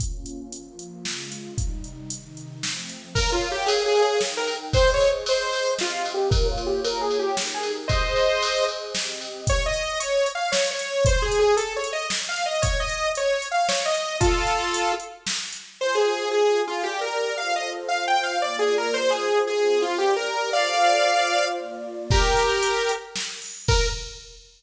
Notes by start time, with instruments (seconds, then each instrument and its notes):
0.00 pad 2 (warm) A#3 C#4 F4, kick, closed hi-hat
0.26 closed hi-hat
0.52 pad 2 (warm) F3 A#3 F4, closed hi-hat
0.79 closed hi-hat
1.05 pad 2 (warm) C#3 G#3 F4, snare
1.32 closed hi-hat
1.58 pad 2 (warm) C3 G3 D#4, kick, closed hi-hat
1.84 closed hi-hat
2.10 pad 2 (warm) C3 D#3 D#4, closed hi-hat
2.37 closed hi-hat
2.63 pad 2 (warm) F3 A3 C4, snare
2.89 closed hi-hat
3.15 lead 2 (sawtooth) A#4, pad 2 (warm) A#4 C#5 F5, kick, crash
3.32 lead 2 (sawtooth) F4
3.42 ride
3.52 lead 2 (sawtooth) G4
3.66 lead 2 (sawtooth) G#4, ride
3.86 lead 2 (sawtooth) G#4
3.95 ride
4.02 lead 2 (sawtooth) G#4
4.21 pad 2 (warm) D#4 A#4 G5, snare
4.37 lead 2 (sawtooth) A#4
4.47 ride
4.73 pad 2 (warm) G#4 C5 D#5, lead 2 (sawtooth) C5, kick, ride
4.94 lead 2 (sawtooth) C#5
5.00 ride
5.26 lead 2 (sawtooth) C5, ride
5.53 ride
5.79 pad 2 (warm) C4 G4 D#5, lead 2 (sawtooth) F4, snare
6.05 ride
6.14 lead 2 (sawtooth) G4
6.30 pad 2 (warm) A#3 F4 C#5, lead 2 (sawtooth) A#4, kick, ride
6.51 lead 2 (sawtooth) F4
6.58 ride
6.66 lead 2 (sawtooth) G4
6.84 lead 2 (sawtooth) A#4, ride
7.01 lead 2 (sawtooth) G#4
7.11 ride
7.19 lead 2 (sawtooth) G4
7.37 pad 2 (warm) D#4 G4 A#4, snare
7.54 lead 2 (sawtooth) G#4
7.63 ride
7.88 pad 2 (warm) G#4 C5 D#5, lead 2 (sawtooth) C5 D#5, kick, ride
8.16 ride
8.42 ride
8.68 ride
8.95 pad 2 (warm) C4 G4 D#5, snare
9.21 ride
9.47 lead 2 (sawtooth) C#5, kick, closed hi-hat
9.66 lead 2 (sawtooth) D#5
9.74 closed hi-hat
10.00 lead 2 (sawtooth) C#5, closed hi-hat
10.26 closed hi-hat
10.35 lead 2 (sawtooth) F5
10.52 lead 2 (sawtooth) C#5, snare
10.71 lead 2 (sawtooth) C#5
10.79 closed hi-hat
11.05 lead 2 (sawtooth) C5, kick, closed hi-hat
11.22 lead 2 (sawtooth) G#4
11.32 closed hi-hat
11.39 lead 2 (sawtooth) G#4
11.57 lead 2 (sawtooth) A4, closed hi-hat
11.76 lead 2 (sawtooth) C#5
11.84 closed hi-hat
11.93 lead 2 (sawtooth) D#5
12.10 snare
12.29 lead 2 (sawtooth) F5
12.36 closed hi-hat
12.46 lead 2 (sawtooth) D#5
12.62 lead 2 (sawtooth) C#5, kick, closed hi-hat
12.80 lead 2 (sawtooth) D#5
12.89 closed hi-hat
13.15 lead 2 (sawtooth) C#5, closed hi-hat
13.42 closed hi-hat
13.51 lead 2 (sawtooth) F5
13.69 lead 2 (sawtooth) C#5, snare
13.85 lead 2 (sawtooth) D#5
13.95 closed hi-hat
14.20 lead 2 (sawtooth) F4 A4, kick, closed hi-hat
14.47 closed hi-hat
14.74 closed hi-hat
15.00 closed hi-hat
15.27 snare
15.53 closed hi-hat
15.79 pad 2 (warm) F4 C5 G#5, lead 2 (sawtooth) C5
15.95 lead 2 (sawtooth) G#4
16.31 pad 2 (warm) F4 G#4 G#5, lead 2 (sawtooth) G#4
16.67 lead 2 (sawtooth) F4
16.83 lead 2 (sawtooth) G4, pad 2 (warm) G4 A#4 D5
17.01 lead 2 (sawtooth) A#4
17.37 pad 2 (warm) F4 A4 C5, lead 2 (sawtooth) F5
17.56 lead 2 (sawtooth) D#5
17.88 pad 2 (warm) F4 C5 F5, lead 2 (sawtooth) F5
18.08 lead 2 (sawtooth) G5
18.23 lead 2 (sawtooth) F5
18.42 pad 2 (warm) A#3 F4 D5, lead 2 (sawtooth) D5
18.59 lead 2 (sawtooth) G#4
18.78 lead 2 (sawtooth) A#4
18.94 pad 2 (warm) F4 G#4 C5, lead 2 (sawtooth) C5
19.10 lead 2 (sawtooth) G#4
19.47 pad 2 (warm) C4 F4 C5, lead 2 (sawtooth) G#4
19.82 lead 2 (sawtooth) F4
19.98 lead 2 (sawtooth) G4, pad 2 (warm) G4 A#4 D5
20.16 lead 2 (sawtooth) A#4
20.52 pad 2 (warm) F4 A4 C5, lead 2 (sawtooth) D5 F5
21.05 pad 2 (warm) F4 C5 F5
21.58 pad 2 (warm) A#3 F4 D5
22.10 lead 2 (sawtooth) G4 A#4, kick, crash
22.37 closed hi-hat
22.63 closed hi-hat
22.89 closed hi-hat
23.16 snare
23.42 open hi-hat
23.68 lead 2 (sawtooth) A#4, kick, crash